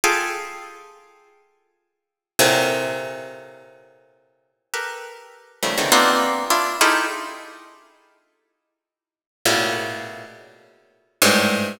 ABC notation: X:1
M:4/4
L:1/16
Q:1/4=102
K:none
V:1 name="Orchestral Harp"
[FG^GA]16 | [A,,^A,,C,]16 | [GA^AB]6 [^C,^D,F,G,=A,] [=C,^C,=D,^D,E,] [^A,B,=C=D^DF]4 [=DEF]2 [^DEFG^G=A]2 | z16 |
[A,,^A,,B,,^C,]6 z6 [G,,^G,,=A,,]4 |]